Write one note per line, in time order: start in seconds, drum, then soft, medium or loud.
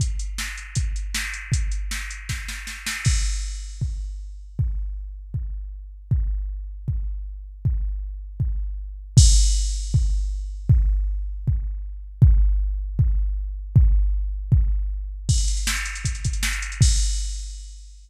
0.00 kick medium
0.00 closed hi-hat medium
0.19 closed hi-hat medium
0.38 snare medium
0.57 closed hi-hat medium
0.75 kick medium
0.75 closed hi-hat medium
0.96 closed hi-hat medium
1.14 snare medium
1.34 closed hi-hat medium
1.52 kick medium
1.52 closed hi-hat medium
1.72 closed hi-hat medium
1.91 snare medium
2.11 closed hi-hat medium
2.29 kick medium
2.29 snare medium
2.48 snare medium
2.67 snare medium
2.86 snare medium
3.05 kick medium
3.05 crash medium
3.81 kick medium
4.59 kick medium
5.34 kick medium
6.11 kick medium
6.88 kick medium
7.65 kick medium
8.40 kick medium
9.17 kick loud
9.17 crash loud
9.94 kick loud
10.69 kick loud
11.48 kick medium
12.22 kick loud
12.99 kick loud
13.76 kick loud
14.52 kick loud
15.29 kick medium
15.29 crash medium
15.38 closed hi-hat medium
15.48 closed hi-hat medium
15.57 closed hi-hat medium
15.67 snare loud
15.77 closed hi-hat medium
15.85 closed hi-hat medium
15.95 closed hi-hat medium
16.05 kick medium
16.05 closed hi-hat medium
16.15 closed hi-hat medium
16.25 kick medium
16.25 closed hi-hat medium
16.33 closed hi-hat medium
16.43 snare medium
16.53 closed hi-hat medium
16.62 closed hi-hat medium
16.72 closed hi-hat medium
16.81 kick loud
16.81 crash loud